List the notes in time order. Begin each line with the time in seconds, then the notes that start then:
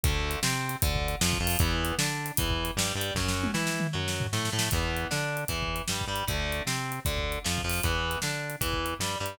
0.03 D2 D3 A3, kick, closed hi-hat
0.31 closed hi-hat
0.43 C3 C4, snare
0.69 closed hi-hat
0.82 D2 D3, kick, closed hi-hat
0.96 kick
1.08 closed hi-hat
1.21 F2 F3, snare
1.33 kick
1.40 F2 F3
1.47 open hi-hat
1.59 E2 E3 B3, kick, closed hi-hat
1.85 closed hi-hat
1.98 D3 D4, snare
2.26 closed hi-hat
2.37 E2 E3, kick, closed hi-hat
2.50 kick
2.65 closed hi-hat
2.76 G2 G3, snare
2.95 G2 G3
3.01 closed hi-hat
3.15 F#2 F#3 C#4, kick, snare
3.28 snare
3.43 high tom
3.54 E3 E4, snare
3.67 snare
3.80 mid tom
3.93 F#2 F#3
4.08 snare
4.20 floor tom
4.33 A2 A3, snare
4.45 snare
4.52 A2 A3
4.59 snare
4.71 E2 E3 B3, kick, closed hi-hat
4.97 closed hi-hat
5.11 D3 D4, snare
5.37 closed hi-hat
5.48 E2 E3, kick, closed hi-hat
5.63 kick
5.76 closed hi-hat
5.88 G2 G3, snare
6.01 kick
6.07 G2 G3
6.16 closed hi-hat
6.28 D2 D3 A3, kick, closed hi-hat
6.52 closed hi-hat
6.66 C3 C4, snare
6.92 closed hi-hat
7.05 D2 D3, kick, closed hi-hat
7.18 kick
7.32 closed hi-hat
7.44 F2 F3, snare
7.58 kick
7.64 F2 F3
7.70 open hi-hat
7.83 E2 E3 B3, kick, closed hi-hat
8.11 closed hi-hat
8.22 D3 D4, snare
8.50 closed hi-hat
8.61 E2 E3, kick, closed hi-hat
8.73 kick
8.86 closed hi-hat
8.99 G2 G3, snare
9.20 G2 G3
9.26 closed hi-hat